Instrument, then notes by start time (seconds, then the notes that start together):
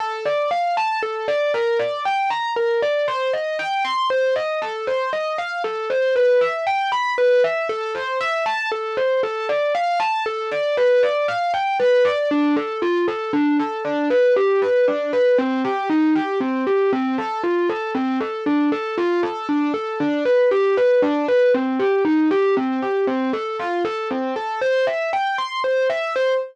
acoustic grand piano
0.00 A4
0.25 D5
0.51 F5
0.77 A5
1.03 A4
1.28 D5
1.54 A#4
1.79 D5
2.05 G5
2.30 A#5
2.56 A#4
2.82 D5
3.08 C5
3.33 D#5
3.59 G5
3.85 C6
4.10 C5
4.36 D#5
4.62 A4
4.87 C5
5.13 D#5
5.38 F5
5.64 A4
5.90 C5
6.16 B4
6.41 E5
6.67 G5
6.92 B5
7.18 B4
7.44 E5
7.69 A4
7.95 C5
8.21 E5
8.46 A5
8.72 A4
8.97 C5
9.23 A4
9.49 D5
9.75 F5
10.00 A5
10.26 A4
10.51 D5
10.77 B4
11.03 D5
11.28 F5
11.54 G5
11.80 B4
12.05 D5
12.31 D4
12.57 A4
12.82 F4
13.08 A4
13.33 D4
13.60 A4
13.85 D4
14.10 B4
14.36 G4
14.62 B4
14.88 D4
15.13 B4
15.38 C4
15.65 G4
15.90 D#4
16.15 G4
16.40 C4
16.67 G4
16.93 C4
17.18 A4
17.43 F4
17.70 A4
17.95 C4
18.21 A4
18.46 D4
18.72 A4
18.98 F4
19.23 A4
19.49 D4
19.74 A4
20.00 D4
20.25 B4
20.51 G4
20.77 B4
21.02 D4
21.28 B4
21.54 C4
21.79 G4
22.05 D#4
22.31 G4
22.57 C4
22.82 G4
23.07 C4
23.33 A4
23.59 F4
23.85 A4
24.11 C4
24.36 A4
24.61 C5
24.87 E5
25.13 G5
25.38 C6
25.64 C5
25.90 E5
26.16 C5